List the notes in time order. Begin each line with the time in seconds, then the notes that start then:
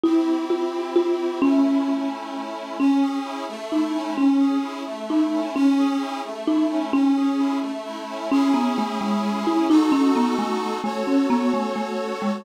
0.03 C4 E4 G4
0.50 F4
0.96 F4
1.42 A3 C#4 E4
2.80 C#4
3.03 G#4
3.25 E4
3.49 A3
3.72 D#4 E4
3.95 C#4
4.17 C#4
4.40 G#4
4.64 E4
4.87 A3
5.10 D#4 E4
5.33 C#4
5.55 C#4
5.79 G#4
6.02 E4
6.25 A3
6.47 D#4 E4
6.71 C#4
6.93 C#4
7.16 G#4
7.40 E4
7.63 A3
7.86 E4
8.09 C#4
8.32 C#4 E4 G#4
8.54 B3
8.78 A3
9.01 G#3
9.47 E4
9.70 D#4 F#4 A4
9.92 C#4
10.16 B3
10.39 A3
10.84 A3 F#4 A4 C#5
11.07 C#4
11.30 B3
11.54 A3
11.76 A3
12.22 G#3